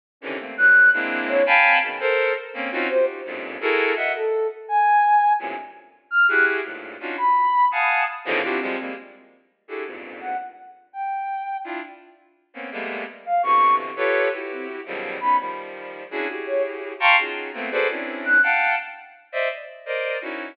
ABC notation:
X:1
M:5/8
L:1/8
Q:1/4=168
K:none
V:1 name="Violin"
z [C,D,^D,E,] [A,^A,C] [E,^F,G,]2 | [^G,^A,CDE]3 [f=g^g=ab]2 | [B,,^C,^D,] [A^A=c]2 z [^A,C^C] | [C^C^DF^F] [D=F^FG]2 [=F,,^F,,G,,^G,,^A,,]2 |
[E^F^GA^A]2 [^de^f] z2 | z5 | [^F,,G,,A,,^A,,C,] z4 | [E^FG^G]2 [=G,,^G,,A,,^A,,]2 [^CD^D=F^F] |
z3 [f^f^ga]2 | z [B,,^C,D,^D,E,F,] [=DEF^FG] [=F,G,^G,] [=G,^G,^A,] | z4 [DE^FG^GA] | [E,,F,,G,,^G,,^A,,]3 z2 |
z5 | [DEF] z4 | [^A,B,C^C] [G,^G,=A,^A,B,]2 z2 | [B,,C,D,E,]3 [FGAB^c]2 |
[E^FG]3 [B,,^C,^D,=F,^F,G,]2 | [B,^C^D] [^D,F,G,]4 | [^CDE^F^G] [EF=G^G]4 | [fga^ac'^c'] [^C^DF^F^G]2 [=A,^A,B,=C] [FG=ABc=d] |
[C^CDE]3 [f^fga]2 | z3 [cd^de] z | z [^Acd^d]2 [^C^DE^F]2 |]
V:2 name="Ocarina"
z ^C z ^f'2 | z2 ^c z =C | z5 | z c z3 |
z3 A2 | z ^g4 | z4 f' | ^f' z4 |
b3 ^d'2 | z2 C3 | z5 | z2 ^f z2 |
z g4 | z5 | z4 f | ^c'2 z3 |
z C z3 | b z4 | z2 ^c z2 | z5 |
z2 ^f' z2 | z5 | z5 |]